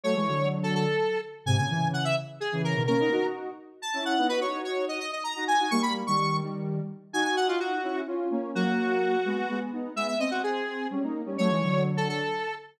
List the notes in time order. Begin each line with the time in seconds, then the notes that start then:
0.03 F#3 A3 C#5
0.15 E3 G#3
0.27 D3 F#3
0.63 A4
0.75 A4
1.46 G#2 C3 G#5
1.57 A#2 C#3 G#5
1.69 C#3 E3
1.93 F#5
2.05 E5
2.40 G#4
2.52 C#3 E3
2.64 A#4
2.75 B2 D#3
2.87 A#3 C#4 A#4
3.00 B3 D#4
3.11 D#4 F#4
3.82 A5
3.94 C#4 E4
4.05 F#5
4.18 B3 D#4
4.29 D#4 F#4 B4
4.41 D#4 F#4 C#5
4.54 D#4 F#4
4.64 C#5
4.88 D#5
5.00 D#5
5.13 D#5
5.24 A#5
5.36 D#4 F#4
5.48 G#5
5.59 D#4 F#4
5.71 G3 A#3 C#6
5.82 B5
6.07 D#3 G3 C#6
6.42 D#3 G3
7.13 D#4 F#4 G#5
7.24 G#5
7.36 F#5
7.48 F4
7.60 F#4
7.83 C#4 E4
8.07 C#4 F4
8.31 A#3 C#4
8.55 F#3 A#3 F#4
9.25 G#3 B3
9.50 G#3 B3
9.72 B3 D#4
9.95 G#3 B3 E5
10.08 E5
10.19 C4 D#5
10.31 F#4
10.43 G#4
10.90 G3 C#4
11.03 A#3 D#4
11.26 G3 C#4
11.38 F#3 A3 C#5
11.50 E3 G#3
11.62 D3 F#3
11.97 A4
12.09 A4